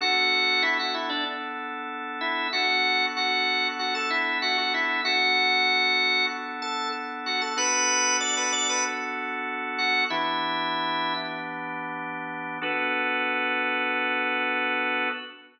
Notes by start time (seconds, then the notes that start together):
0.01 B3 D4 F#4 A4 F#5
0.63 E4 E5
0.79 F#4 F#5
0.94 E4 E5
1.09 D4 D5
2.21 E4 E5
2.53 B3 D4 F#4 A4 F#5
3.17 F#4 F#5
3.79 F#4 F#5
3.95 A4 A5
4.10 E4 E5
4.42 F#4 F#5
4.58 F#4 F#5
4.74 E4 E5
5.05 B3 D4 F#4 A4 F#5
6.62 A4 A5
7.26 F#4 F#5
7.42 A4 A5
7.56 B3 D4 F#4 A4 B4 B5
8.20 D5 D6
8.37 B4 B5
8.52 D5 D6
8.69 B4 B5
9.78 F#4 F#5
10.10 E3 B3 D4 E4 G4 E5
12.61 B3 D4 F#4 A4 B4